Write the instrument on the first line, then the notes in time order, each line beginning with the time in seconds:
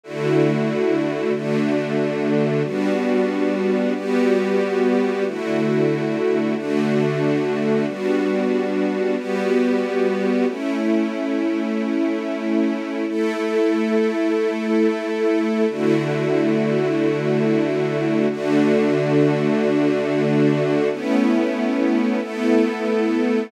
string ensemble 1
0.03 D3 A3 E4 F#4
1.34 D3 A3 D4 F#4
2.64 G3 B3 D4 F#4
3.95 G3 B3 F#4 G4
5.26 D3 A3 E4 F#4
6.56 D3 A3 D4 F#4
7.86 G3 B3 D4 F#4
9.17 G3 B3 F#4 G4
10.47 A3 C#4 E4
13.08 A3 E4 A4
15.68 D3 A3 E4 F#4
18.30 D3 A3 D4 F#4
20.91 A3 B3 C#4 E4
22.21 A3 B3 E4 A4